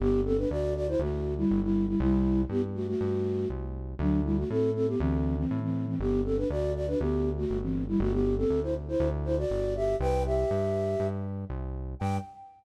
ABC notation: X:1
M:4/4
L:1/16
Q:1/4=120
K:G
V:1 name="Flute"
[B,G]2 [CA] [DB] [Fd]2 [Fd] [Ec] [A,F]3 [G,E]2 [G,E]2 [G,E] | [G,E]4 [B,G] z [A,F] [A,F]5 z4 | [F,D]2 [G,E] [A,F] [CA]2 [CA] [B,G] [E,C]3 [E,C]2 [E,C]2 [E,C] | [B,G]2 [CA] [DB] [Fd]2 [Fd] [DB] [B,G]3 [A,F]2 [E,C]2 [G,E] |
[A,F] [B,G]2 [CA]2 [Ec] z [Ec]2 z [Ec] [Fd]3 [Ge]2 | [Bg]2 [Ge]8 z6 | g4 z12 |]
V:2 name="Synth Bass 1" clef=bass
G,,,4 D,,4 D,,4 G,,,4 | C,,4 G,,4 G,,4 C,,4 | D,,4 A,,4 D,,4 A,,4 | G,,,4 D,,4 D,,4 G,,,4 |
G,,,4 D,,4 D,,4 G,,,4 | C,,4 G,,4 G,,4 C,,4 | G,,4 z12 |]